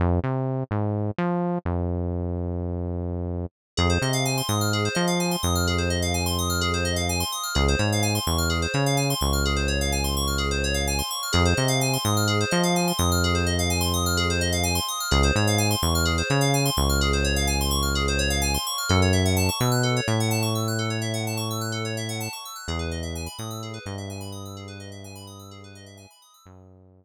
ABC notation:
X:1
M:4/4
L:1/16
Q:1/4=127
K:Fm
V:1 name="Synth Bass 1" clef=bass
F,,2 C,4 A,,4 F,4 F,,2- | F,,16 | F,,2 C,4 A,,4 F,4 F,,2- | F,,16 |
D,,2 A,,4 =E,,4 D,4 D,,2- | D,,16 | F,,2 C,4 A,,4 F,4 F,,2- | F,,16 |
D,,2 A,,4 =E,,4 D,4 D,,2- | D,,16 | [K:F#m] F,,6 B,,4 A,,6- | A,,16 |
E,,6 A,,4 =G,,6- | =G,,16 | F,,6 z10 |]
V:2 name="Electric Piano 2"
z16 | z16 | A c e f a c' e' f' A c e f a c' e' f' | A c e f a c' e' f' A c e f a c' e' f' |
A c d f a c' d' f' A c d f a c' d' f' | A c d f a c' d' f' A c d f a c' d' f' | A c e f a c' e' f' A c e f a c' e' f' | A c e f a c' e' f' A c e f a c' e' f' |
A c d f a c' d' f' A c d f a c' d' f' | A c d f a c' d' f' A c d f a c' d' f' | [K:F#m] A c e f a c' e' f' A c e f a c' e' f' | A c e f a c' e' f' A c e f a c' e' f' |
G B ^d e g b ^d' e' G B d e g b d' e' | G B ^d e g b ^d' e' G B d e g b d' e' | z16 |]